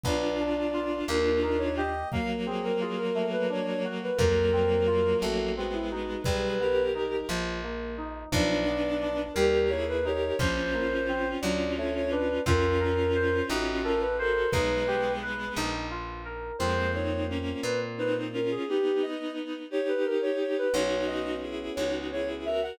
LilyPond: <<
  \new Staff \with { instrumentName = "Ocarina" } { \time 6/8 \key b \major \tempo 4. = 58 d''4. ais'8 ais'16 cis''16 dis''8 | eis''16 r16 gis'16 ais'16 gis'16 ais'8 b'16 cis''16 cis''16 r16 b'16 | ais'4. fis'8 fis'16 e'16 fis'8 | b'4 r2 |
d''4. ais'8 cis''16 b'16 cis''8 | bis'4. d''8 cis''16 cis''16 b'8 | ais'4. fis'8 ais'16 b'16 ais'8 | b'4 r2 |
bis'8 cis''8 r8 b'16 r16 b'16 r16 ais'16 gis'16 | g'8 dis''8 r8 cis''16 b'16 ais'16 cis''16 cis''16 b'16 | cis''8 dis''8 r8 cis''16 r16 cis''16 r16 e''16 fis''16 | }
  \new Staff \with { instrumentName = "Violin" } { \time 6/8 \key b \major <d' f'>2. | <fis ais>2. | <fis ais>2 <gis b>4 | <gis' b'>8 <g' ais'>4 r4. |
<b d'>4. <g' ais'>8 <e' gis'>8 <g' ais'>8 | <cis' eis'>2. | <cis' eis'>2~ <cis' eis'>8 <fis' a'>8 | <gis b>2 r4 |
<gis bis>8 <bis dis'>8 <ais cis'>8 r8 <bis dis'>8 <cis' eis'>8 | <b dis'>4. <dis' g'>4. | <dis' fis'>4 <e' gis'>8 <dis' fis'>8 <e' gis'>8 <fis' ais'>8 | }
  \new Staff \with { instrumentName = "Electric Piano 2" } { \time 6/8 \key b \major b8 d'8 f'8 ais8 dis'8 g'8 | ais8 bis8 eis'8 a8 d'8 fis'8 | ais8 bis8 eis'8 a8 c'8 ees'8 | g8 b8 dis'8 eis8 ais8 dis'8 |
f8 b8 d'8 g8 ais8 dis'8 | eis8 ais8 bis8 fis8 a8 d'8 | eis'8 ais'8 bis'8 ees'8 a'8 c''8 | dis'8 g'8 b'8 dis'8 eis'8 ais'8 |
<ais bis eis'>2. | r2. | <b cis' fis'>2. | }
  \new Staff \with { instrumentName = "Electric Bass (finger)" } { \clef bass \time 6/8 \key b \major b,,4. dis,4. | r2. | eis,4. a,,4. | b,,4. ais,,4. |
b,,4. dis,4. | ais,,4. d,4. | eis,4. a,,4. | b,,4. ais,,4. |
eis,4. ais,4. | r2. | b,,4. cis,4. | }
  \new DrumStaff \with { instrumentName = "Drums" } \drummode { \time 6/8 bd4. r4. | bd4. r4. | bd4. r4. | bd4. r4. |
bd4. r4. | bd4. r4. | bd4. r4. | bd4. r4. |
r4. r4. | r4. r4. | r4. r4. | }
>>